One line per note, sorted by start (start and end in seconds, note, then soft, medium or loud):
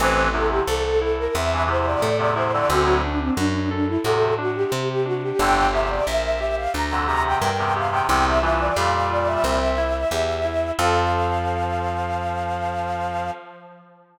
0.00 0.61 A1 loud
0.00 0.29 G2 loud
0.00 0.29 E3 loud
0.00 0.31 C4 medium
0.00 0.27 C5 loud
0.33 0.63 E2 medium
0.33 0.63 C3 loud
0.33 0.64 E4 medium
0.33 0.50 A4 loud
0.50 0.66 G4 loud
0.67 1.28 C2 medium
0.67 0.97 A4 medium
0.67 0.83 A4 loud
0.84 1.00 A4 loud
1.01 1.32 E4 medium
1.01 1.17 A4 medium
1.19 1.35 A#4 loud
1.35 1.96 E2 medium
1.35 1.65 C4 medium
1.35 1.63 E5 loud
1.53 1.69 G2 medium
1.53 1.69 E3 loud
1.67 2.10 E2 medium
1.67 2.10 C3 loud
1.67 1.99 E4 medium
1.67 1.86 C5 loud
1.87 2.02 D5 loud
2.02 2.63 A2 medium
2.02 2.33 A4 medium
2.02 2.18 D5 loud
2.19 2.35 E2 loud
2.19 2.35 C3 loud
2.19 2.35 D5 medium
2.36 2.52 E2 medium
2.36 2.52 C3 loud
2.36 2.66 E4 loud
2.36 2.53 C5 medium
2.53 2.70 F2 loud
2.53 2.70 D3 loud
2.53 2.69 D5 loud
2.69 3.30 D2 loud
2.69 2.86 F#2 loud
2.69 2.86 D3 loud
2.69 3.00 C4 loud
2.69 2.97 F#4 loud
2.86 3.02 A2 medium
2.86 3.02 F#3 loud
3.04 3.20 D4 loud
3.04 3.34 D4 medium
3.20 3.36 C4 loud
3.37 3.98 F#2 medium
3.37 3.53 D4 loud
3.37 3.67 F#4 medium
3.54 3.70 D4 loud
3.71 3.88 D4 loud
3.71 4.01 A4 medium
3.87 4.03 E4 loud
4.04 4.34 E2 medium
4.04 4.65 A2 medium
4.04 4.34 C3 loud
4.04 4.35 F#4 medium
4.04 4.34 A4 loud
4.38 4.69 D4 medium
4.38 4.56 F#4 loud
4.55 4.71 G4 loud
4.72 5.32 C3 medium
4.72 5.02 C4 medium
4.72 4.89 G4 medium
4.90 5.06 G4 loud
5.05 5.36 D4 medium
5.05 5.21 F#4 loud
5.23 5.39 G4 loud
5.39 6.00 G1 loud
5.39 5.67 F2 loud
5.39 5.67 D3 loud
5.39 5.70 D4 medium
5.39 5.71 G5 loud
5.73 6.03 E2 medium
5.73 6.03 C3 medium
5.73 6.04 G4 medium
5.73 5.89 E5 loud
5.90 6.06 D5 loud
6.07 6.68 A#1 medium
6.07 6.37 A#4 medium
6.07 6.24 E5 loud
6.24 6.39 E5 medium
6.39 6.71 G4 medium
6.39 6.55 E5 loud
6.57 6.73 F5 loud
6.74 7.35 D2 medium
6.74 7.04 D4 medium
6.74 7.03 A#5 medium
6.91 7.07 F2 loud
6.91 7.07 D3 loud
7.07 7.50 E2 medium
7.07 7.50 C3 loud
7.07 7.38 G4 medium
7.07 7.23 A#5 loud
7.26 7.41 G5 loud
7.41 8.02 G2 medium
7.41 7.71 A#4 medium
7.41 7.57 G5 loud
7.58 7.75 E2 loud
7.58 7.75 C3 loud
7.58 7.74 G5 medium
7.75 7.91 E2 medium
7.75 7.91 C3 loud
7.75 8.06 G4 medium
7.75 7.93 F5 medium
7.91 8.08 E2 loud
7.91 8.08 C3 loud
7.91 8.07 G5 loud
8.09 8.70 C2 medium
8.09 8.39 E2 loud
8.09 8.39 C3 loud
8.09 8.40 C4 medium
8.09 8.25 G5 loud
8.26 8.42 E5 loud
8.42 8.73 G2 loud
8.42 8.73 E3 loud
8.42 8.73 F4 medium
8.42 8.58 E5 loud
8.60 8.76 D5 loud
8.76 9.37 F2 medium
8.76 9.59 A#2 loud
8.76 9.59 G3 loud
8.76 9.07 G4 medium
8.76 9.09 F5 loud
9.10 9.41 F4 medium
9.10 9.28 D5 loud
9.27 10.71 E5 loud
9.44 10.05 C2 medium
9.44 9.75 C4 loud
9.78 10.08 E4 medium
10.11 10.72 E2 medium
10.11 10.42 G4 medium
10.45 10.75 E4 medium
10.79 13.31 F2 loud
10.79 13.31 F3 loud
10.79 13.30 C4 loud
10.79 13.30 F4 loud
10.79 13.30 A4 medium
10.79 13.31 F5 loud